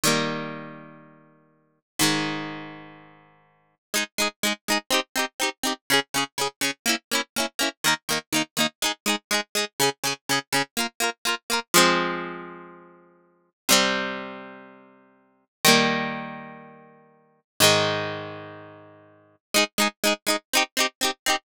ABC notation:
X:1
M:4/4
L:1/8
Q:1/4=123
K:Fm
V:1 name="Acoustic Guitar (steel)"
[E,G,B,]8 | [A,,E,A,]8 | [K:Ab] [A,EA] [A,EA] [A,EA] [A,EA] [CEG] [CEG] [CEG] [CEG] | [D,DA] [D,DA] [D,DA] [D,DA] [B,D_F] [B,DF] [B,DF] [B,DF] |
[E,B,E] [E,B,E] [E,B,E] [E,B,E] [A,EA] [A,EA] [A,EA] [A,EA] | [D,DA] [D,DA] [D,DA] [D,DA] [B,FB] [B,FB] [B,FB] [B,FB] | [K:Fm] [F,A,C]8 | [C,G,C]8 |
[E,G,B,]8 | [A,,E,A,]8 | [K:Ab] [A,EA] [A,EA] [A,EA] [A,EA] [CEG] [CEG] [CEG] [CEG] |]